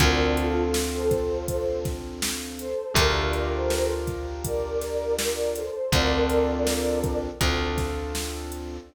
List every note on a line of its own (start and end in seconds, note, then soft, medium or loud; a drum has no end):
0.00 2.74 D2 medium
0.00 2.66 C4 medium
0.00 2.66 D4 medium
0.00 2.66 F4 medium
0.00 2.66 A4 medium
0.00 0.32 A#4 medium
0.00 0.32 D5 medium
0.00 kick medium
0.00 closed hi-hat medium
0.37 0.72 F4 medium
0.37 0.72 A4 medium
0.37 closed hi-hat medium
0.74 snare medium
0.94 1.45 A4 medium
0.94 1.45 C5 medium
1.11 kick medium
1.11 closed hi-hat medium
1.48 1.81 A4 medium
1.48 1.81 C5 medium
1.48 kick medium
1.48 closed hi-hat medium
1.85 kick medium
1.85 snare soft
1.85 closed hi-hat medium
2.22 snare loud
2.59 2.92 A4 medium
2.59 2.92 C5 medium
2.59 closed hi-hat medium
2.94 5.70 D2 medium
2.94 5.62 D4 medium
2.94 5.62 F4 medium
2.94 5.62 G4 medium
2.94 5.62 A#4 medium
2.94 3.16 A#4 medium
2.94 3.16 D5 medium
2.94 kick medium
2.94 closed hi-hat loud
3.17 3.52 A#4 medium
3.17 3.52 D5 medium
3.33 closed hi-hat medium
3.54 3.89 A4 medium
3.54 3.89 C5 medium
3.70 snare medium
4.07 kick medium
4.07 closed hi-hat medium
4.44 5.13 A#4 medium
4.44 5.13 D5 medium
4.44 kick medium
4.44 closed hi-hat medium
4.81 snare soft
4.81 closed hi-hat medium
5.19 5.53 A#4 medium
5.19 5.53 D5 medium
5.19 snare loud
5.56 5.93 A4 medium
5.56 5.93 C5 medium
5.56 closed hi-hat medium
5.92 7.30 D2 medium
5.92 7.29 C4 medium
5.92 7.29 D4 medium
5.92 7.29 F4 medium
5.92 7.29 A4 medium
5.92 7.17 A#4 medium
5.92 7.17 D5 medium
5.92 kick medium
5.92 closed hi-hat medium
6.30 closed hi-hat medium
6.67 snare medium
7.04 kick medium
7.04 closed hi-hat medium
7.41 8.79 D2 medium
7.41 8.77 C4 medium
7.41 8.77 D4 medium
7.41 8.77 F4 medium
7.41 8.77 A4 medium
7.41 kick medium
7.41 closed hi-hat medium
7.78 kick medium
7.78 snare soft
7.78 closed hi-hat medium
8.15 snare medium
8.52 closed hi-hat medium